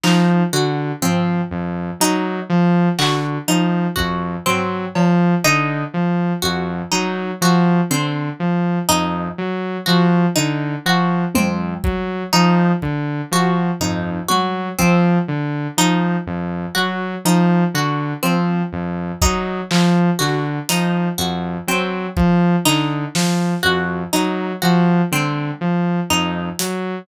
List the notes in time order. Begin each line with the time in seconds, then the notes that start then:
0.03 F3 D#4, clap
0.53 D3 F#4
1.02 F3 C4, floor tom
1.51 F2
2.00 F#3 D#4
2.49 F3
2.99 D3 F#4, clap
3.48 F3 D#4, cowbell
3.96 F2 F#4, kick
4.46 F#3 C4, floor tom
4.95 F3, cowbell
5.44 D3 D#4
5.94 F3
6.42 F2 F#4
6.92 F#3 D#4
7.41 F3 F#4
7.90 D3 C4
8.40 F3
8.89 F2 D#4
9.38 F#3
9.86 F3 F#4
10.36 D3 D#4
10.85 F3 F#4
11.35 F2 C4, high tom
11.84 F#3, kick
12.33 F3 D#4
12.82 D3, kick
13.31 F3 F#4
13.81 F2 D#4, floor tom
14.28 F#3 F#4, high tom
14.78 F3 C4, kick
15.28 D3
15.77 F3 D#4
16.26 F2
16.75 F#3 F#4
17.25 F3 D#4
17.74 D3 F#4
18.23 F3 C4
18.72 F2
19.22 F#3 D#4, kick
19.71 F3, clap
20.19 D3 F#4, clap
20.69 F3 D#4, closed hi-hat
21.18 F2 F#4
21.67 F#3 C4
22.17 F3, kick
22.65 D3 D#4, clap
23.15 F3, snare
23.63 F2 F#4
24.13 F#3 D#4, closed hi-hat
24.62 F3 F#4
25.12 D3 C4, high tom
25.61 F3
26.10 F2 D#4
26.59 F#3, closed hi-hat